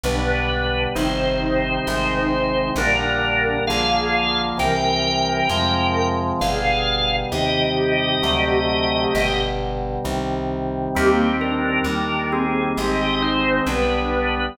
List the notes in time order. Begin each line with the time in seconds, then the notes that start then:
0.04 B1 B2 D3 G3 D4 B4
0.95 G1 C3 D#3 G3 D#4 C5
1.87 G#1 C3 D#3 G#3
2.76 A#1 A#2 D3 G3 D4 A#4
3.67 A#1 D3 F3 A#3 G#4 F5
4.58 C2 C3 E3 G3 A#4 G5
5.49 F2 C3 F3 G#3
6.40 G1 B2 D3 G3 G#4 F5
7.32 D#2 C3 D#3 G3 G4 D#5
8.22 D2 C3 D3 F#3 A3
9.14 G1 B2 D3 G3
10.05 C2 C3 D#3 G3
10.95 D#2 D#3 G3 A#3 C4 G4
11.41 D4 A#4
11.84 D#2 D#3 G3 A#3 D4 A#4
12.32 C4 G#4
12.77 G#1 D#3 G#3 C4 G4 D#5
13.22 D#4 C5
13.66 B1 D3 G3 B3 D4 B4